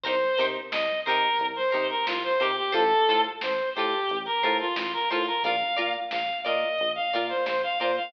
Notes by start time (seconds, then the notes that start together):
0.04 C2 D#4 G4 A#4 C5, kick, closed hi-hat
0.21 closed hi-hat
0.37 C3 D#4 G4 A#4 C5, closed hi-hat
0.55 closed hi-hat
0.72 C2 D#5, snare
0.88 closed hi-hat
1.05 C3 D#4 G4 A#4 C5, closed hi-hat
1.22 closed hi-hat
1.39 C2, kick, closed hi-hat
1.56 C5, closed hi-hat
1.71 C3 D#4 G4 A#4 C5, closed hi-hat
1.89 A#4, closed hi-hat
2.06 C2 F4, snare
2.23 C5, closed hi-hat
2.40 C3 D#4 G4 A#4 C5, closed hi-hat
2.57 G4, closed hi-hat
2.72 A1 F4 A4 C5, kick, closed hi-hat
2.91 closed hi-hat
3.08 A2 F4 A4 C5, closed hi-hat
3.24 closed hi-hat
3.41 A1 C5, snare
3.59 closed hi-hat
3.75 A2 F4 G4 A4 C5, closed hi-hat
3.92 kick, closed hi-hat
4.09 A1, kick, closed hi-hat
4.26 A#4, closed hi-hat
4.42 A2 F4 A4 C5, kick, snare, closed hi-hat
4.59 F4, closed hi-hat
4.76 A1 F4, snare
4.93 A#4, closed hi-hat
5.10 A2 F4 A4 C5, snare, closed hi-hat
5.27 A#4, snare, closed hi-hat
5.44 A#1 F4 A#4 D5 F5, kick, closed hi-hat
5.61 closed hi-hat
5.77 A#2 F4 A#4 D5, closed hi-hat
5.95 closed hi-hat
6.11 A#1 F5, snare
6.28 closed hi-hat
6.44 A#2 F4 A#4 D5 D#5, snare, closed hi-hat
6.61 closed hi-hat
6.78 A#1, kick, closed hi-hat
6.95 F5, closed hi-hat
7.13 A#2 F4 A#4 D5, closed hi-hat
7.29 C5, snare, closed hi-hat
7.46 A#1 C5, snare
7.63 F5, closed hi-hat
7.79 A#2 F4 A#4 C5 D5, closed hi-hat
7.96 F5, closed hi-hat